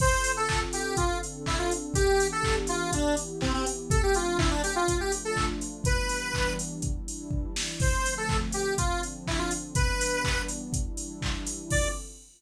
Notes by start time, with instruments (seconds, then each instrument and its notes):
0.00 pad 2 (warm) D3 C4 F4 A4, lead 1 (square) C5, kick, crash
0.24 open hi-hat
0.37 lead 1 (square) A4
0.49 kick, clap
0.73 lead 1 (square) G4, open hi-hat
0.97 pad 2 (warm) D3 C4 D4 A4, lead 1 (square) F4, kick, closed hi-hat
1.23 open hi-hat
1.46 lead 1 (square) E4, kick, clap
1.59 lead 1 (square) F4
1.71 open hi-hat
1.94 pad 2 (warm) E3 B3 D4 G4, lead 1 (square) G4, kick, closed hi-hat
2.20 open hi-hat
2.32 lead 1 (square) A4
2.43 kick, clap
2.67 lead 1 (square) F4, open hi-hat
2.92 pad 2 (warm) E3 B3 E4 G4, lead 1 (square) D4, kick, closed hi-hat
3.17 open hi-hat
3.41 lead 1 (square) C4, kick, clap
3.54 lead 1 (square) C4
3.66 open hi-hat
3.90 pad 2 (warm) F3 A3 C4 D4, lead 1 (square) A4, kick, closed hi-hat
4.03 lead 1 (square) G4
4.14 lead 1 (square) F4, open hi-hat
4.39 lead 1 (square) E4, kick, clap
4.51 lead 1 (square) D4
4.63 lead 1 (square) G4, open hi-hat
4.76 lead 1 (square) F4
4.88 pad 2 (warm) F3 A3 D4 F4, kick, closed hi-hat
5.00 lead 1 (square) G4
5.12 open hi-hat
5.25 lead 1 (square) A4
5.36 kick, clap
5.61 open hi-hat
5.84 pad 2 (warm) E3 G3 B3 D4, lead 1 (square) B4, kick, closed hi-hat
6.09 open hi-hat
6.34 kick, clap
6.59 open hi-hat
6.82 pad 2 (warm) E3 G3 D4 E4, kick, closed hi-hat
7.08 open hi-hat
7.31 kick
7.56 snare
7.80 pad 2 (warm) D3 F3 A3 C4, lead 1 (square) C5, kick, crash
8.06 open hi-hat
8.17 lead 1 (square) A4
8.29 kick, clap
8.52 lead 1 (square) G4, open hi-hat
8.78 pad 2 (warm) D3 F3 C4 D4, lead 1 (square) F4, kick, closed hi-hat
9.03 open hi-hat
9.27 lead 1 (square) E4, kick, clap
9.39 lead 1 (square) F4
9.51 open hi-hat
9.75 pad 2 (warm) E3 G3 B3 D4, lead 1 (square) B4, kick, closed hi-hat
10.01 open hi-hat
10.24 kick, clap
10.48 open hi-hat
10.73 pad 2 (warm) E3 G3 D4 E4, kick, closed hi-hat
10.97 open hi-hat
11.22 kick, clap
11.47 open hi-hat
11.70 pad 2 (warm) D3 C4 F4 A4, lead 1 (square) D5, kick, crash